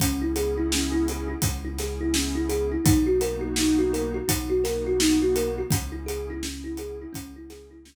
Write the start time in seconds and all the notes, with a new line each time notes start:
0.00 C#2 B3 C#4 E4 G#4, kick, closed hi-hat
0.22 E4
0.36 G#4, closed hi-hat
0.57 E4
0.72 C#4, snare
0.92 E4
1.08 G#4, closed hi-hat
1.28 E4
1.42 C#2 B3 C#4 E4 G#4, kick, closed hi-hat
1.65 E4
1.78 G#4, snare, closed hi-hat
2.01 E4
2.14 C#4, snare
2.35 E4
2.49 G#4, closed hi-hat
2.72 E4
2.85 B1 A#3 B3 D#4 F#4, kick, closed hi-hat
3.07 F#4
3.21 A#4, closed hi-hat
3.41 F#4
3.56 D#4, snare
3.79 F#4
3.93 A#4, closed hi-hat
4.14 F#4
4.28 B1 A#3 B3 D#4 F#4, kick, closed hi-hat
4.50 F#4
4.64 A#4, snare, closed hi-hat
4.87 F#4
5.00 D#4, snare
5.22 F#4
5.36 A#4, closed hi-hat
5.58 F#4
5.71 C#2 B3 C#4 E4 G#4, kick, closed hi-hat
5.92 E4
6.06 G#4, closed hi-hat
6.30 E4
6.43 B3 C#4 E4 G#4, snare
6.64 E4
6.77 G#4, closed hi-hat
7.02 E4
7.13 C#2 B3 C#4 E4 G#4, kick, closed hi-hat
7.36 E4
7.50 G#4, snare, closed hi-hat
7.71 E4
7.85 B3 C#4 E4 G#4, snare